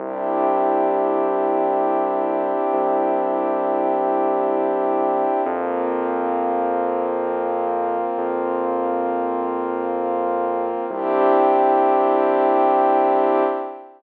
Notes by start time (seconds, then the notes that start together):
0.00 C2 C4 D4 E4 G4
2.73 C2
5.46 F2 A#3 C4 F4
8.18 F2
10.90 C2 C4 D4 E4 G4